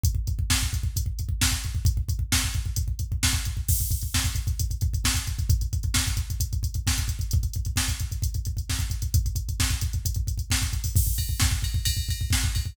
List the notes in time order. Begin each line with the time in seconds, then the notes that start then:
0.04 kick, closed hi-hat
0.15 kick
0.27 kick, closed hi-hat
0.39 kick
0.50 kick, snare
0.62 kick
0.73 kick, closed hi-hat
0.83 kick
0.96 kick, closed hi-hat
1.06 kick
1.19 kick, closed hi-hat
1.29 kick
1.41 kick, snare
1.52 kick
1.64 kick, closed hi-hat
1.75 kick
1.85 kick, closed hi-hat
1.97 kick
2.09 kick, closed hi-hat
2.19 kick
2.32 kick, snare
2.44 kick
2.54 kick, closed hi-hat
2.66 kick
2.76 kick, closed hi-hat
2.88 kick
2.99 kick, closed hi-hat
3.12 kick
3.23 kick, snare
3.33 kick
3.45 kick, closed hi-hat
3.57 kick
3.68 kick, crash
3.79 kick, closed hi-hat
3.91 kick, closed hi-hat
4.02 kick, closed hi-hat
4.14 kick, snare
4.24 kick, closed hi-hat
4.35 kick, closed hi-hat
4.47 kick, closed hi-hat
4.59 kick, closed hi-hat
4.71 kick, closed hi-hat
4.81 kick, closed hi-hat
4.94 kick, closed hi-hat
5.04 kick, snare
5.14 kick, closed hi-hat
5.27 kick, closed hi-hat
5.39 kick, closed hi-hat
5.49 kick, closed hi-hat
5.61 kick, closed hi-hat
5.73 kick, closed hi-hat
5.83 kick, closed hi-hat
5.94 kick, snare
6.07 kick, closed hi-hat
6.17 kick, closed hi-hat
6.30 kick, closed hi-hat
6.40 kick, closed hi-hat
6.53 kick, closed hi-hat
6.63 kick, closed hi-hat
6.74 kick, closed hi-hat
6.87 kick, snare
6.98 kick, closed hi-hat
7.08 kick, closed hi-hat
7.19 kick, closed hi-hat
7.31 kick, closed hi-hat
7.43 kick, closed hi-hat
7.54 kick, closed hi-hat
7.65 kick, closed hi-hat
7.76 kick, snare
7.88 kick, closed hi-hat
8.00 kick, closed hi-hat
8.12 kick, closed hi-hat
8.22 kick, closed hi-hat
8.34 kick, closed hi-hat
8.45 kick, closed hi-hat
8.57 kick, closed hi-hat
8.70 kick, snare
8.79 kick, closed hi-hat
8.90 kick, closed hi-hat
9.02 kick, closed hi-hat
9.14 kick, closed hi-hat
9.26 kick, closed hi-hat
9.36 kick, closed hi-hat
9.49 kick, closed hi-hat
9.60 kick, snare
9.70 kick, closed hi-hat
9.81 kick, closed hi-hat
9.93 kick, closed hi-hat
10.05 kick, closed hi-hat
10.14 kick, closed hi-hat
10.27 kick, closed hi-hat
10.38 kick, closed hi-hat
10.50 kick, snare
10.62 kick, closed hi-hat
10.73 kick, closed hi-hat
10.84 kick, open hi-hat
10.96 kick, crash
11.07 kick
11.18 kick, ride
11.29 kick
11.40 kick, snare
11.51 kick
11.62 kick, ride
11.74 kick
11.85 kick, ride
11.97 kick
12.09 kick, ride
12.21 kick
12.30 kick, snare
12.44 kick
12.55 kick, ride
12.66 kick